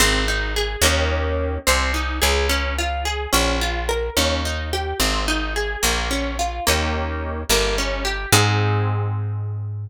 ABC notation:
X:1
M:6/8
L:1/8
Q:3/8=72
K:Ab
V:1 name="Acoustic Guitar (steel)"
C E A [B,DEG]3 | C E A D F A | D F B D E G | C E A B, D F |
[B,DEG]3 B, D G | [CEA]6 |]
V:2 name="Electric Bass (finger)" clef=bass
A,,,3 E,,3 | C,,2 D,,4 | B,,,3 E,,3 | A,,,3 B,,,3 |
E,,3 G,,,3 | A,,6 |]